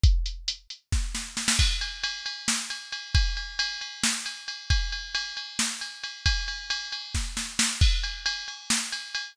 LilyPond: \new DrumStaff \drummode { \time 7/8 \tempo 4 = 135 <hh bd>8 hh8 hh8 hh8 <bd sn>8 sn8 sn16 sn16 | <cymc bd>8 cymr8 cymr8 cymr8 sn8 cymr8 cymr8 | <bd cymr>8 cymr8 cymr8 cymr8 sn8 cymr8 cymr8 | <bd cymr>8 cymr8 cymr8 cymr8 sn8 cymr8 cymr8 |
<bd cymr>8 cymr8 cymr8 cymr8 <bd sn>8 sn8 sn8 | <cymc bd>8 cymr8 cymr8 cymr8 sn8 cymr8 cymr8 | }